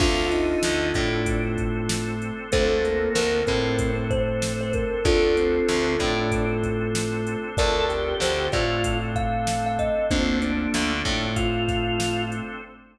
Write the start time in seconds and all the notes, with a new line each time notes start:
0.00 D2 C4 D4 F4 A4, kick, crash
0.31 D#4, closed hi-hat
0.63 D2 D3, snare
0.94 A2 A3 D4, kick, snare, closed hi-hat
1.26 C4 D4 A4 C5, kick, closed hi-hat
1.57 kick, closed hi-hat
1.89 snare
2.22 closed hi-hat
2.52 D2 A3 C4 D4 F4 A4 C5, kick, closed hi-hat
2.84 A#3, closed hi-hat
3.15 D2 D3 A#4, snare
3.47 A2 A3 C4 A#4, kick, snare, closed hi-hat
3.78 C4 D4 A4 C5, kick, closed hi-hat
4.11 C5, kick, closed hi-hat
4.42 snare
4.61 C5
4.73 A#4, kick, closed hi-hat
5.04 D2 C4 D4 F4 A4, kick, closed hi-hat
5.37 C4, closed hi-hat
5.68 D2 D3, snare
5.99 A2 A3 D4, kick, snare, closed hi-hat
6.31 C4 D4 A4 C5, kick, closed hi-hat
6.63 kick, closed hi-hat
6.95 snare
7.27 closed hi-hat
7.57 D2 C4 D4 F4 A4 A#4 D5, kick, closed hi-hat
7.89 G4, closed hi-hat
8.20 D2 D3 C5, snare
8.52 A2 A3 F4 D5, kick, snare, closed hi-hat
8.84 C4 D4 A4 C5, kick, closed hi-hat
9.16 F5, kick, closed hi-hat
9.47 snare
9.66 F5
9.79 D#5, kick, closed hi-hat
10.10 D2 A#3 C4 D4 F4 A4, kick, closed hi-hat
10.42 D4, closed hi-hat
10.74 D2 D3, snare
11.05 A2 A3, kick, snare, closed hi-hat
11.36 C4 D4 F4 A4 C5, kick, closed hi-hat
11.68 kick, snare, closed hi-hat
12.00 snare
12.32 closed hi-hat